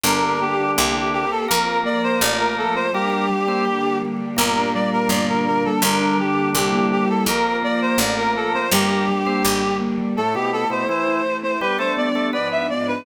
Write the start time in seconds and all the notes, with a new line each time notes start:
0.03 G1 D3 A#3 D4 G4 A#4
0.22 G4
0.40 G3 A#3 G4
0.57 D4
0.76 C2 A#3 C4 E4 G4
0.93 C4
1.13 A#3 C4 E4 G4 A#4
1.31 G4 A4
1.48 F2 A#3 C4 F4 A#4
1.65 F4
1.84 F3 A#3 F4 D5
2.03 C4 C5
2.20 A1 A3 C4 F4 D5
2.39 F4 A#4
2.56 F3 A3 F4 A4
2.75 C4 C5
2.93 G3 A#3 D4 G4 A#4
3.10 A#3 D4 A#4
3.30 G3
3.48 A#3 C4 C5
3.64 D3 G3 D4 G4
3.83 D4
4.03 A#3
4.21 G3
4.36 G1 A#2 G3 A#3 D4 A#4
4.57 D4
4.74 G3 D5
4.91 A#3 A#4
5.09 G1 D3 G3 D4 D5
5.28 D4 A#4
5.47 A#3 A#4
5.64 G3 A4
5.82 G1 D3 G3 A#3 D4 A#4
6.00 D4
6.19 D3 G3 D4 G4
6.35 A#3
6.55 C2 G3 A#3 C4 E4 G4
6.73 A#3
6.91 G3 A#3 C4 E4 G4
7.09 E4 A4
7.26 F2 A#3 C4 F4 A#4
7.45 F4
7.63 F3 A#3 F4 D5
7.81 C4 C5
7.98 A1 A3 C4 F4 D5
8.17 F4 A#4
8.35 F3 A3 F4 A4
8.54 C4 C5
8.71 G1 G3 A#3 D4 G4 A#4
8.89 A#3 D4 A#4
9.09 G3
9.26 A#3 C4 C5
9.43 G#1 D3 G3 D4 G4
9.61 D4
9.80 A#3
9.98 G3
10.16 A2 A3 C4 E4 A4
10.34 B2 B3 E4 G4
10.52 C4 A4
10.70 B2 B3 E4 C5
10.87 E3 A3 E4 C5
11.07 E4
11.24 E4
11.43 C4 C5
11.61 G3 B3 D4 G4 B4
11.78 A3 D4 A4 C5
11.97 G3 B3 D4 G4 D5
12.15 A3 D4 A4
12.33 G#2 F3 G#3 B3 D4 B4 D5
12.51 F4 E5
12.69 G#2 F3 G#3 B3 D4 D5
12.87 D4 B4